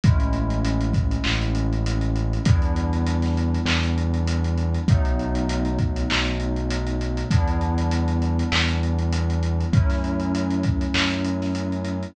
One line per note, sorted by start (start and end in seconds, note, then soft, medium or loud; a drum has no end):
0.04 1.17 A1 loud
0.04 2.42 G#3 loud
0.04 2.42 A3 medium
0.04 2.42 C#4 medium
0.04 2.42 E4 loud
0.04 kick loud
0.04 closed hi-hat loud
0.20 closed hi-hat medium
0.33 closed hi-hat medium
0.50 closed hi-hat medium
0.65 closed hi-hat loud
0.81 closed hi-hat medium
0.94 kick medium
0.94 closed hi-hat medium
1.11 closed hi-hat medium
1.24 2.39 A1 medium
1.24 clap loud
1.42 closed hi-hat medium
1.55 closed hi-hat medium
1.73 closed hi-hat medium
1.86 closed hi-hat loud
2.01 closed hi-hat medium
2.16 closed hi-hat medium
2.33 closed hi-hat medium
2.45 3.58 E2 medium
2.45 4.84 G3 medium
2.45 4.84 B3 medium
2.45 4.84 D4 loud
2.45 4.84 E4 loud
2.45 kick loud
2.45 closed hi-hat loud
2.62 closed hi-hat medium
2.76 closed hi-hat medium
2.93 closed hi-hat medium
3.07 closed hi-hat loud
3.22 snare soft
3.22 closed hi-hat medium
3.37 closed hi-hat medium
3.54 closed hi-hat medium
3.66 4.78 E2 medium
3.66 clap loud
3.83 closed hi-hat medium
3.98 closed hi-hat medium
4.14 closed hi-hat medium
4.28 closed hi-hat loud
4.44 closed hi-hat medium
4.58 closed hi-hat medium
4.74 closed hi-hat medium
4.88 6.03 B1 loud
4.88 7.27 F#3 medium
4.88 7.27 A3 loud
4.88 7.27 B3 loud
4.88 7.27 D#4 loud
4.88 kick loud
4.88 closed hi-hat loud
5.05 closed hi-hat medium
5.19 closed hi-hat medium
5.35 closed hi-hat medium
5.49 closed hi-hat loud
5.65 closed hi-hat medium
5.79 kick medium
5.79 closed hi-hat medium
5.96 closed hi-hat medium
6.10 7.24 B1 medium
6.10 clap loud
6.25 closed hi-hat medium
6.40 closed hi-hat medium
6.56 closed hi-hat medium
6.70 closed hi-hat loud
6.87 closed hi-hat medium
7.01 closed hi-hat medium
7.17 closed hi-hat medium
7.31 8.43 E2 loud
7.31 9.69 G3 loud
7.31 9.69 B3 loud
7.31 9.69 D4 loud
7.31 9.69 E4 loud
7.31 kick medium
7.31 closed hi-hat loud
7.48 closed hi-hat medium
7.61 closed hi-hat medium
7.78 closed hi-hat medium
7.91 closed hi-hat loud
8.08 closed hi-hat medium
8.22 closed hi-hat medium
8.39 closed hi-hat medium
8.52 9.65 E2 medium
8.52 clap loud
8.68 closed hi-hat medium
8.83 closed hi-hat medium
8.99 closed hi-hat medium
9.13 closed hi-hat loud
9.30 closed hi-hat medium
9.43 closed hi-hat medium
9.60 closed hi-hat medium
9.73 10.86 F#2 loud
9.73 12.11 F#3 medium
9.73 12.11 A3 medium
9.73 12.11 C#4 loud
9.73 12.11 E4 medium
9.73 kick loud
9.73 closed hi-hat medium
9.90 snare soft
9.90 closed hi-hat medium
10.04 closed hi-hat medium
10.20 closed hi-hat medium
10.35 closed hi-hat loud
10.51 closed hi-hat medium
10.63 kick medium
10.63 closed hi-hat medium
10.81 closed hi-hat medium
10.94 12.07 F#2 loud
10.94 clap loud
11.10 closed hi-hat medium
11.24 closed hi-hat medium
11.42 snare soft
11.42 closed hi-hat medium
11.55 closed hi-hat medium
11.72 closed hi-hat medium
11.85 closed hi-hat medium
12.03 closed hi-hat medium